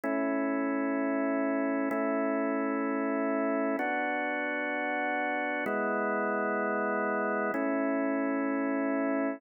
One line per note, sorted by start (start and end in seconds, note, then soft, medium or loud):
0.04 1.89 A3 medium
0.04 1.89 C#4 medium
0.04 1.89 E4 medium
1.91 3.77 A3 medium
1.91 3.77 C#4 medium
1.91 3.77 E4 medium
3.79 5.65 B3 medium
3.79 5.65 D4 medium
3.79 5.65 F#4 medium
5.66 7.52 G#3 medium
5.66 7.52 B3 medium
5.66 7.52 E4 medium
7.54 9.40 A3 medium
7.54 9.40 C#4 medium
7.54 9.40 E4 medium